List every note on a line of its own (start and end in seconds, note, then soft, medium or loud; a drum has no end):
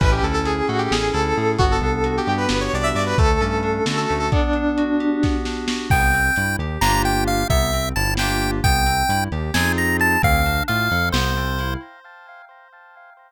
0.00 0.20 A1 loud
0.00 0.90 C#4 loud
0.00 0.10 B4 medium
0.00 kick loud
0.00 crash loud
0.12 0.23 G4 medium
0.23 0.62 D2 medium
0.23 1.12 E4 medium
0.23 0.33 A4 medium
0.23 closed hi-hat medium
0.34 0.44 A4 medium
0.45 0.68 G#4 medium
0.45 1.36 G#4 medium
0.45 closed hi-hat loud
0.68 0.88 A2 medium
0.68 0.79 F#4 medium
0.68 1.55 A4 medium
0.68 closed hi-hat medium
0.78 0.89 G4 medium
0.90 1.11 A1 medium
0.90 1.55 C#4 medium
0.90 1.11 G#4 medium
0.90 snare loud
1.13 1.33 D2 medium
1.13 1.56 E4 medium
1.13 1.52 A4 medium
1.13 closed hi-hat medium
1.36 1.57 A2 medium
1.36 1.58 G#4 medium
1.36 open hi-hat medium
1.58 1.79 G1 medium
1.58 2.50 B3 loud
1.58 1.69 F#4 loud
1.58 kick loud
1.58 closed hi-hat loud
1.71 2.13 A4 medium
1.81 2.19 C2 medium
1.81 2.73 D4 medium
1.81 closed hi-hat medium
2.04 2.94 F#4 medium
2.04 closed hi-hat loud
2.17 2.28 G4 medium
2.27 2.46 G2 medium
2.27 3.14 G4 medium
2.27 2.39 G4 medium
2.27 closed hi-hat medium
2.37 2.57 B4 medium
2.49 2.69 G1 medium
2.49 3.15 B3 medium
2.49 snare loud
2.61 2.71 C#5 medium
2.73 2.93 C2 medium
2.73 3.16 D4 medium
2.73 2.85 D5 medium
2.73 closed hi-hat medium
2.83 2.94 E5 medium
2.95 3.14 G2 medium
2.95 3.16 F#4 medium
2.95 3.06 D5 medium
2.95 open hi-hat medium
3.06 3.17 B4 medium
3.18 3.38 D2 medium
3.18 4.09 A3 loud
3.18 3.39 A4 loud
3.18 kick loud
3.18 closed hi-hat loud
3.40 3.80 G2 medium
3.40 4.27 C#4 medium
3.40 3.83 A4 medium
3.40 closed hi-hat medium
3.63 4.28 D4 medium
3.63 closed hi-hat medium
3.86 4.05 D3 medium
3.86 4.30 F#4 medium
3.86 3.96 A4 medium
3.86 snare loud
3.97 4.18 A4 medium
4.09 4.30 D2 medium
4.09 4.31 A3 medium
4.09 open hi-hat medium
4.19 4.30 A4 medium
4.31 5.22 B3 medium
4.31 5.31 D4 medium
4.31 kick loud
4.31 closed hi-hat loud
4.53 5.45 D4 medium
4.53 closed hi-hat medium
4.77 5.68 F#4 medium
4.77 closed hi-hat loud
4.99 5.86 G4 medium
4.99 closed hi-hat medium
5.22 5.87 B3 medium
5.22 kick loud
5.22 snare medium
5.45 5.89 D4 medium
5.45 snare medium
5.68 5.90 F#4 medium
5.68 snare loud
5.90 6.30 C2 loud
5.90 6.12 B3 medium
5.90 6.56 G5 medium
5.90 kick loud
5.90 crash loud
6.13 6.34 C4 medium
6.13 closed hi-hat medium
6.36 6.56 G2 medium
6.36 6.58 E4 medium
6.36 closed hi-hat loud
6.59 6.78 D#2 medium
6.59 6.79 G4 medium
6.59 closed hi-hat medium
6.81 7.44 G1 loud
6.81 7.43 A#3 medium
6.81 7.43 D4 medium
6.81 7.43 F4 loud
6.81 7.43 G4 medium
6.81 7.02 A#5 medium
6.81 snare loud
7.05 7.24 G5 medium
7.05 closed hi-hat medium
7.27 7.48 F5 medium
7.27 closed hi-hat medium
7.50 7.93 C2 loud
7.50 7.70 B3 loud
7.50 7.89 E5 medium
7.50 kick loud
7.50 closed hi-hat loud
7.73 7.93 C4 medium
7.73 closed hi-hat medium
7.96 8.61 G1 loud
7.96 8.16 E4 medium
7.96 8.14 A5 medium
7.96 closed hi-hat medium
8.17 8.59 A#3 medium
8.17 8.59 D4 medium
8.17 8.59 F4 medium
8.17 8.59 G4 loud
8.17 8.51 G5 medium
8.17 snare loud
8.42 closed hi-hat medium
8.64 9.03 C2 loud
8.64 8.84 B3 medium
8.64 9.24 G5 medium
8.64 kick loud
8.64 closed hi-hat loud
8.86 9.06 C4 medium
8.86 closed hi-hat medium
9.09 9.28 G2 medium
9.09 9.30 E4 medium
9.09 closed hi-hat loud
9.31 9.51 D#2 loud
9.31 9.52 G4 medium
9.31 closed hi-hat medium
9.54 10.17 F2 loud
9.54 10.16 C4 medium
9.54 10.16 D#4 medium
9.54 10.16 F4 loud
9.54 10.16 G#4 medium
9.54 9.72 G#5 medium
9.54 snare loud
9.78 9.97 A#5 medium
9.78 closed hi-hat medium
10.00 10.22 A5 medium
10.00 closed hi-hat medium
10.22 10.62 D2 loud
10.22 10.42 C4 loud
10.22 10.63 F5 medium
10.22 kick loud
10.22 closed hi-hat loud
10.45 10.66 D4 medium
10.45 closed hi-hat medium
10.68 10.89 A2 loud
10.68 10.89 F4 medium
10.68 11.09 F5 medium
10.68 closed hi-hat loud
10.91 11.11 F2 loud
10.91 11.11 A4 medium
10.91 closed hi-hat medium
11.12 11.76 C2 loud
11.12 11.34 B3 medium
11.12 11.74 C5 medium
11.12 snare loud
11.37 11.57 C4 medium
11.37 closed hi-hat medium
11.59 11.80 E4 medium
11.59 closed hi-hat loud